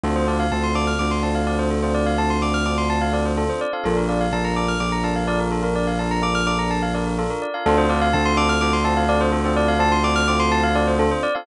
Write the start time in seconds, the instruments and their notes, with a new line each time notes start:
0.03 synth bass 2 D2, electric piano 1 C4 D4 F4 A4, tubular bells A4
0.16 tubular bells C5
0.27 electric piano 1 C4 D4 F4 A4, tubular bells D5
0.40 tubular bells F5
0.52 synth bass 2 D2, electric piano 1 C4 D4 F4 A4, tubular bells A5
0.63 tubular bells C6
0.75 electric piano 1 C4 D4 F4 A4, tubular bells D6
0.87 tubular bells F6
0.99 synth bass 2 D2, tubular bells D6
1.11 tubular bells C6
1.23 electric piano 1 C4 D4 F4 A4, tubular bells A5
1.35 tubular bells F5
1.47 electric piano 1 C4 D4 F4 A4, tubular bells D5
1.59 tubular bells C5
1.71 tubular bells A4
1.83 electric piano 1 C4 D4 F4 A4, tubular bells C5
1.94 tubular bells D5
2.06 tubular bells F5
2.18 electric piano 1 C4 D4 F4 A4, tubular bells A5
2.30 tubular bells C6
2.42 electric piano 1 C4 D4 F4 A4, tubular bells D6
2.54 tubular bells F6
2.66 electric piano 1 C4 D4 F4 A4, tubular bells D6
2.78 tubular bells C6
2.90 tubular bells A5
3.01 tubular bells F5
3.12 electric piano 1 C4 D4 F4 A4, tubular bells D5
3.25 tubular bells C5
3.37 electric piano 1 C4 D4 F4 A4, tubular bells A4
3.49 tubular bells C5
3.61 tubular bells D5
3.73 electric piano 1 C4 D4 F4 A4, tubular bells F5
3.84 synth bass 2 A#1, electric piano 1 D4 F4 A4 A#4, tubular bells A4
3.97 tubular bells A#4
4.09 electric piano 1 D4 F4 A4 A#4, tubular bells D5
4.21 tubular bells F5
4.33 synth bass 2 A#1, electric piano 1 D4 F4 A4 A#4, tubular bells A5
4.44 tubular bells A#5
4.56 electric piano 1 D4 F4 A4 A#4, tubular bells D6
4.68 tubular bells F6
4.80 synth bass 2 A#1, tubular bells D6
4.92 tubular bells A#5
5.04 electric piano 1 D4 F4 A4 A#4, tubular bells A5
5.16 tubular bells F5
5.27 electric piano 1 D4 F4 A4 A#4, tubular bells D5
5.40 tubular bells A#4
5.52 tubular bells A4
5.62 electric piano 1 D4 F4 A4 A#4, tubular bells A#4
5.76 tubular bells D5
5.87 tubular bells F5
5.99 electric piano 1 D4 F4 A4 A#4, tubular bells A5
6.11 tubular bells A#5
6.22 electric piano 1 D4 F4 A4 A#4, tubular bells D6
6.35 tubular bells F6
6.47 electric piano 1 D4 F4 A4 A#4, tubular bells D6
6.59 tubular bells A#5
6.71 tubular bells A5
6.82 tubular bells F5
6.94 electric piano 1 D4 F4 A4 A#4, tubular bells D5
7.06 tubular bells A#4
7.18 electric piano 1 D4 F4 A4 A#4, tubular bells A4
7.30 tubular bells A#4
7.42 tubular bells D5
7.54 electric piano 1 D4 F4 A4 A#4, tubular bells F5
7.66 synth bass 2 D2, electric piano 1 C4 D4 F4 A4, tubular bells A4
7.78 tubular bells C5
7.89 electric piano 1 C4 D4 F4 A4, tubular bells D5
8.02 tubular bells F5
8.13 synth bass 2 D2, electric piano 1 C4 D4 F4 A4, tubular bells A5
8.25 tubular bells C6
8.37 electric piano 1 C4 D4 F4 A4, tubular bells D6
8.49 tubular bells F6
8.61 synth bass 2 D2, tubular bells D6
8.73 tubular bells C6
8.84 electric piano 1 C4 D4 F4 A4, tubular bells A5
8.97 tubular bells F5
9.09 electric piano 1 C4 D4 F4 A4, tubular bells D5
9.21 tubular bells C5
9.32 tubular bells A4
9.44 electric piano 1 C4 D4 F4 A4, tubular bells C5
9.56 tubular bells D5
9.68 tubular bells F5
9.79 electric piano 1 C4 D4 F4 A4, tubular bells A5
9.92 tubular bells C6
10.03 electric piano 1 C4 D4 F4 A4, tubular bells D6
10.16 tubular bells F6
10.28 electric piano 1 C4 D4 F4 A4, tubular bells D6
10.40 tubular bells C6
10.52 tubular bells A5
10.63 tubular bells F5
10.75 electric piano 1 C4 D4 F4 A4, tubular bells D5
10.87 tubular bells C5
10.98 electric piano 1 C4 D4 F4 A4, tubular bells A4
11.11 tubular bells C5
11.23 tubular bells D5
11.35 electric piano 1 C4 D4 F4 A4, tubular bells F5